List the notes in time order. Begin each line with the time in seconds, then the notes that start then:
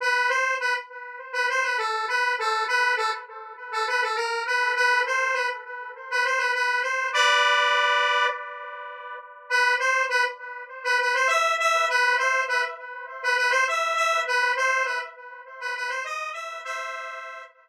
0.00 B4
0.29 C5
0.60 B4
1.33 B4
1.49 C5
1.63 B4
1.77 A4
2.08 B4
2.39 A4
2.67 B4
2.96 A4
3.72 A4
3.87 B4
4.02 A4
4.15 A#4
4.46 B4
4.75 B4
5.06 C5
5.33 B4
6.10 B4
6.25 C5
6.38 B4
6.54 B4
6.82 C5
7.13 B4 D5
9.50 B4
9.79 C5
10.09 B4
10.84 B4
11.00 B4
11.14 C5
11.27 E5
11.59 E5
11.89 B4
12.18 C5
12.48 B4
13.23 B4
13.37 B4
13.50 C5
13.67 E5
13.95 E5
14.27 B4
14.56 C5
14.85 B4
15.60 B4
15.76 B4
15.89 C5
16.04 D#5
16.32 E5
16.64 C5 E5